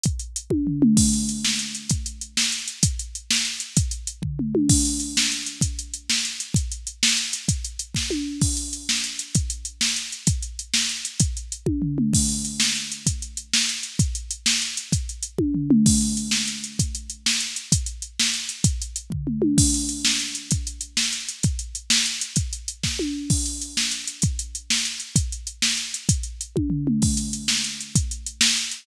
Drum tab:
CC |------|x-----|------|------|
HH |xxx---|-xx-xx|xxx-xx|xxx-xx|
SD |------|---o--|---o--|---o--|
T1 |---o--|------|------|------|
T2 |-----o|------|------|------|
FT |----o-|------|------|------|
BD |o--o--|o-----|o-----|o-----|

CC |------|x-----|------|------|
HH |xxx---|-xx-xx|xxx-xx|xxx-xx|
SD |------|---o--|---o--|---o--|
T1 |-----o|------|------|------|
T2 |----o-|------|------|------|
FT |---o--|------|------|------|
BD |o--o--|o-----|o-----|o-----|

CC |------|x-----|------|------|
HH |xxx---|-xx-xx|xxx-xx|xxx-xx|
SD |---o--|---o--|---o--|---o--|
T1 |----o-|------|------|------|
T2 |------|------|------|------|
FT |------|------|------|------|
BD |o--o--|o-----|o-----|o-----|

CC |------|x-----|------|------|
HH |xxx---|-xx-xx|xxx-xx|xxx-xx|
SD |------|---o--|---o--|---o--|
T1 |---o--|------|------|------|
T2 |-----o|------|------|------|
FT |----o-|------|------|------|
BD |o--o--|o-----|o-----|o-----|

CC |------|x-----|------|------|
HH |xxx---|-xx-xx|xxx-xx|xxx-xx|
SD |------|---o--|---o--|---o--|
T1 |---o--|------|------|------|
T2 |-----o|------|------|------|
FT |----o-|------|------|------|
BD |o--o--|o-----|o-----|o-----|

CC |------|x-----|------|------|
HH |xxx---|-xx-xx|xxx-xx|xxx-xx|
SD |------|---o--|---o--|---o--|
T1 |-----o|------|------|------|
T2 |----o-|------|------|------|
FT |---o--|------|------|------|
BD |o--o--|o-----|o-----|o-----|

CC |------|x-----|------|------|
HH |xxx---|-xx-xx|xxx-xx|xxx-xx|
SD |---o--|---o--|---o--|---o--|
T1 |----o-|------|------|------|
T2 |------|------|------|------|
FT |------|------|------|------|
BD |o--o--|o-----|o-----|o-----|

CC |------|x-----|------|
HH |xxx---|-xx-xx|xxx-xx|
SD |------|---o--|---o--|
T1 |---o--|------|------|
T2 |-----o|------|------|
FT |----o-|------|------|
BD |o--o--|o-----|o-----|